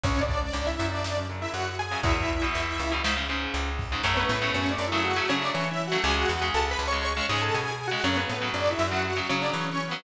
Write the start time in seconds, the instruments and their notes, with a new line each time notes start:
0.04 electric bass (finger) C#2, overdriven guitar G#2 C#3, lead 2 (sawtooth) C#4 C#5, kick, closed hi-hat
0.21 lead 2 (sawtooth) D4 D5
0.29 kick, closed hi-hat
0.37 lead 2 (sawtooth) D4 D5
0.41 overdriven guitar G#2 C#3
0.53 electric bass (finger) C#2, lead 2 (sawtooth) D4 D5, closed hi-hat
0.67 lead 2 (sawtooth) E4 E5
0.79 overdriven guitar F#2 C#3, electric bass (finger) F#2, closed hi-hat
0.92 lead 2 (sawtooth) D4 D5
1.04 snare
1.17 overdriven guitar F#2 C#3
1.29 overdriven guitar F#2 C#3, closed hi-hat
1.42 lead 2 (sawtooth) E4 E5
1.54 electric bass (finger) F#2, lead 2 (sawtooth) F#4 F#5, closed hi-hat
1.79 lead 2 (sawtooth) G#4 G#5, closed hi-hat
1.91 overdriven guitar F#2 C#3
2.03 electric bass (finger) E2, overdriven guitar E2 B2, lead 2 (sawtooth) E4 E5, kick, closed hi-hat
2.29 closed hi-hat
2.42 overdriven guitar E2 B2
2.55 electric bass (finger) E2, closed hi-hat
2.79 electric bass (finger) C#2, closed hi-hat
2.92 overdriven guitar E2 B2
3.04 overdriven guitar G#2 C#3, snare
3.16 overdriven guitar G#2 C#3
3.29 overdriven guitar G#2 C#3, closed hi-hat
3.54 electric bass (finger) C#2, closed hi-hat
3.79 kick, open hi-hat
3.92 overdriven guitar G#2 C#3
4.03 electric bass (finger) F#2, overdriven guitar C#3 F#3 A3, lead 2 (sawtooth) C#4 C#5
4.17 lead 2 (sawtooth) B3 B4
4.29 electric bass (finger) A2, lead 2 (sawtooth) B3 B4
4.42 overdriven guitar C#3 F#3 A3
4.54 electric bass (finger) F#2, lead 2 (sawtooth) C#4 C#5
4.71 lead 2 (sawtooth) D4 D5
4.78 electric bass (finger) F#2
4.87 lead 2 (sawtooth) E4 E5
4.92 overdriven guitar C#3 F#3 A3
5.04 lead 2 (sawtooth) F#4 F#5
5.16 overdriven guitar C#3 F#3 A3
5.29 overdriven guitar C#3 F#3 A3, electric bass (finger) C#3, lead 2 (sawtooth) C#4 C#5
5.42 lead 2 (sawtooth) D4 D5
5.54 electric bass (finger) E3, lead 2 (sawtooth) C#4 C#5
5.71 lead 2 (sawtooth) E4 E5
5.87 lead 2 (sawtooth) F#4 F#5
5.92 overdriven guitar C#3 F#3 A3
6.04 electric bass (finger) C#2, overdriven guitar C#3 G#3, lead 2 (sawtooth) G#4 G#5
6.16 lead 2 (sawtooth) F#4 F#5
6.29 electric bass (finger) E2, lead 2 (sawtooth) F#4 F#5
6.42 overdriven guitar C#3 G#3
6.54 electric bass (finger) C#2, lead 2 (sawtooth) A4 A5
6.71 lead 2 (sawtooth) B4 B5
6.79 electric bass (finger) C#2
6.88 lead 2 (sawtooth) C#5 C#6
6.92 overdriven guitar C#3 G#3
7.04 lead 2 (sawtooth) C#5 C#6
7.17 overdriven guitar C#3 G#3
7.29 electric bass (finger) G#2, overdriven guitar C#3 G#3, lead 2 (sawtooth) G#4 G#5
7.42 lead 2 (sawtooth) A4 A5
7.54 electric bass (finger) B2, lead 2 (sawtooth) G#4 G#5
7.71 lead 2 (sawtooth) G#4 G#5
7.88 overdriven guitar C#3 G#3, lead 2 (sawtooth) F#4 F#5
8.04 electric bass (finger) F#2, overdriven guitar C#3 F#3, lead 2 (sawtooth) C#4 C#5
8.17 lead 2 (sawtooth) B3 B4
8.29 electric bass (finger) A2, lead 2 (sawtooth) B3 B4
8.42 overdriven guitar C#3 F#3
8.54 electric bass (finger) F#2, lead 2 (sawtooth) D4 D5
8.71 lead 2 (sawtooth) E4 E5
8.79 electric bass (finger) F#2
8.88 overdriven guitar C#3 F#3, lead 2 (sawtooth) F#4 F#5
9.04 lead 2 (sawtooth) F#4 F#5
9.17 overdriven guitar C#3 F#3
9.29 overdriven guitar C#3 F#3, electric bass (finger) C#3, lead 2 (sawtooth) C#4 C#5
9.42 lead 2 (sawtooth) D4 D5
9.54 electric bass (finger) E3, lead 2 (sawtooth) C#4 C#5
9.71 lead 2 (sawtooth) C#4 C#5
9.87 overdriven guitar C#3 F#3, lead 2 (sawtooth) B3 B4